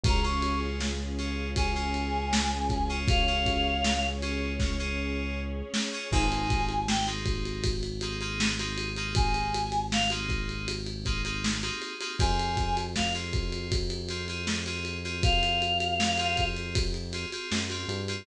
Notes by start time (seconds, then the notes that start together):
0.03 C#2 C#4 F4 G#4 A#5, kick, ride
0.23 C#4 F4 G#4 C#6
0.42 ride
0.80 snare
1.18 C#4 F4 G#4, ride
1.56 C#4 F4 G#4 G#5, kick, ride
1.75 C#4 F4 G#4
1.94 ride
2.33 snare
2.70 kick, ride
2.89 C#4 F4 G#4
3.08 C#4 G#4 C#5 F5, kick, ride
3.27 C#4 F4 G#4
3.46 kick, ride
3.84 snare
4.22 C#4 F4 G#4, ride
4.59 C#4 F4 G#4, kick, snare
4.79 C#4 F4 G#4
5.74 snare
5.93 C#4 F4 G#4
6.11 G#1 A#3 C4 D#4 G#4 G#5, kick, crash
6.32 ride
6.50 kick, ride
6.69 ride
6.88 G5, snare
7.07 A#3 C4 D#4 G#4, ride
7.26 kick, ride
7.45 ride
7.64 kick, ride
7.83 ride
8.01 A#3 C4 D#4 G#4, ride
8.21 A#3 C4 D#4 G#4, ride
8.40 snare
8.59 A#3 C4 D#4 G#4, ride
8.78 ride
8.97 A#3 C4 D#4 G#4, ride
9.15 G#5, kick, ride
9.34 ride
9.54 ride
9.72 ride
9.92 F5, snare
10.10 A#3 C4 D#4 G#4, ride
10.29 kick, ride
10.49 ride
10.68 ride
10.86 ride
11.05 A#3 C4 D#4 G#4, kick, ride
11.25 A#3 C4 D#4 G#4, ride
11.44 snare
11.63 A#3 C4 D#4 G#4, ride
11.82 ride
12.01 A#3 C4 D#4 G#4, ride
12.19 F2 C4 F4 G#4 G#5, kick, ride
12.39 ride
12.57 kick, ride
12.77 ride
12.96 F5, kick, snare
13.15 C4 F4 G#4, ride
13.33 kick, ride
13.52 ride
13.72 kick, ride
13.90 ride
14.09 C4 F4 G#4, ride
14.28 C4 F4 G#4, ride
14.47 snare
14.66 C4 F4 G#4, ride
14.85 ride
15.04 C4 F4 G#4, ride
15.23 F5, kick, ride
15.43 ride
15.62 ride
15.80 ride
16.00 snare
16.18 C4 F4 G#4, ride
16.37 kick, ride
16.56 ride
16.75 kick, ride
16.94 ride
17.13 C4 F4 G#4, ride
17.32 C4 F4 G#4, ride
17.52 F#2, snare
17.70 C4 F4 G#4, ride
17.88 G2, ride
18.08 C4 F4 G#4, ride